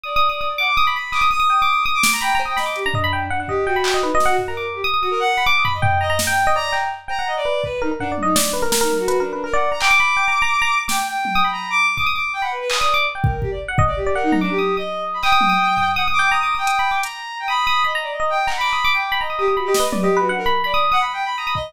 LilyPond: <<
  \new Staff \with { instrumentName = "Electric Piano 1" } { \time 3/4 \tempo 4 = 166 \tuplet 3/2 { ees'''8 ees'''8 ees'''8 } ees'''16 r16 d'''8 ees'''16 b''16 b''8 | ees'''16 ees'''16 ees'''16 ees'''16 \tuplet 3/2 { g''8 d'''8 d'''8 } ees'''16 r16 d'''16 r16 | \tuplet 3/2 { b''8 bes''8 ees'''8 } b''16 d'''8 bes''16 ees''16 b''16 g''16 r16 | ges''16 ges''16 ees''8 g''16 b''16 g''16 ees''16 \tuplet 3/2 { b'8 ees''8 ges''8 } |
r16 bes''16 d'''8. ees'''16 ees'''16 ees'''8 r8 b''16 | d'''8 b''16 r16 g''8 bes''16 bes''16 r16 g''8 ees''16 | d''8 g''8 r8 g''16 ges''8 r16 b'8 | r8 bes'16 bes'16 \tuplet 3/2 { ges''8 d''8 ees''8 } d''8 b'16 bes'16 |
bes'16 bes'8 r16 \tuplet 3/2 { b'8 bes'8 b'8 } bes'16 d''8 bes''16 | g''16 d'''16 b''8 \tuplet 3/2 { g''8 bes''8 bes''8 } r16 bes''16 r8 | d'''16 r4 ees'''16 b''4 r8 | d'''16 ees'''16 d'''16 r8 b''8 r16 \tuplet 3/2 { ees'''8 ees'''8 d'''8 } |
r16 g''8 r4 ges''16 ees''16 r8 d''16 | ges''8 bes''16 d'''8 ees'''8 ees'''4~ ees'''16 | ees'''16 ees'''8 ees'''8 ees'''16 ees'''8 \tuplet 3/2 { ees'''8 ees'''8 g''8 } | \tuplet 3/2 { bes''8 d'''8 ees'''8 ees'''8 b''8 d'''8 } r4 |
r16 ees'''8 ees'''8 b''16 bes''8 r16 ees''8 r16 | \tuplet 3/2 { bes''8 d'''8 ees'''8 } d'''16 d'''8 b''16 bes''16 ees'''16 ees'''16 ees'''16 | \tuplet 3/2 { b''8 ees''8 b'8 d''8 ees''8 b'8 } ges''16 r16 b''8 | b''16 ees'''8 ees'''16 r4 ees'''16 ees'''16 r8 | }
  \new Staff \with { instrumentName = "Violin" } { \time 3/4 d''4. ges''16 d'''8. b''8 | d'''16 ees'''16 ees'''8 ees'''4 ees'''16 d'''8 bes''16 | g''8 r16 g''16 ees''8 g'16 d'4~ d'16 | d'16 d'16 g'8 ges'4 ees'16 ges'8 ges'16 |
r16 bes'8 r16 g'16 r8 ges'16 bes'16 ges''8. | d'''16 ees'''16 b''16 ees''8. ees''8 r16 g''8. | bes''8 r4 bes''8 ees''16 d''8. | b'8 ees'16 r16 \tuplet 3/2 { d'8 d'8 ees'8 } d'8. bes'16 |
r16 ees'8 ges'16 \tuplet 3/2 { ges'8 d'8 d'8 } bes'16 ges''8 bes''16 | d'''2. | g''8 g''4~ g''16 bes''8 d'''8 d'''16 | ees'''8 d'''8 g''16 ges''16 b'16 b'16 r16 d''8. |
r8 bes'8 g'16 d''16 r8. d''16 g'8 | bes'16 ees'8 d'16 g'8. ees''8. r16 b''16 | g''2 ges''16 r16 d'''8 | ees'''16 ees'''8 g''4~ g''16 bes''4 |
g''16 b''4 ees''8 d''16 ees''8 g''8 | ges''16 b''4 g''8. ees''8 g'16 g'16 | ges'16 g'16 ees''16 b'8 g'8 ges'16 d'16 bes'16 r8 | d''8 r16 ges''16 \tuplet 3/2 { b''8 g''8 b''8 } bes''16 b''16 ees''8 | }
  \new DrumStaff \with { instrumentName = "Drums" } \drummode { \time 3/4 r4 r4 r4 | hc4 r4 r8 sn8 | r8 cb8 sn8 hh8 tomfh4 | r8 bd8 r8 hc8 r8 sn8 |
tomfh4 r4 r4 | cb8 tomfh8 tomfh4 sn4 | cb8 hc8 r8 cb8 r4 | bd4 tomfh8 tommh8 sn4 |
sn8 tommh8 hh4 r4 | hc4 r4 r4 | sn4 tommh4 r4 | bd4 r4 hc4 |
r8 bd8 bd4 bd4 | r8 tommh8 r4 r4 | hc8 tommh8 r8 tomfh8 r4 | r4 hh4 hh4 |
r4 r4 r4 | hc8 hc8 r4 r4 | r8 sn8 tommh4 r4 | r4 r4 r8 bd8 | }
>>